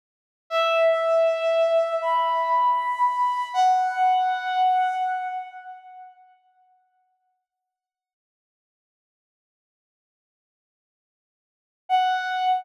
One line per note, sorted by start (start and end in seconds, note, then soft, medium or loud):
0.50 1.93 E5 medium
2.02 3.46 B5 medium
3.54 4.95 F#5 medium
11.89 12.60 F#5 medium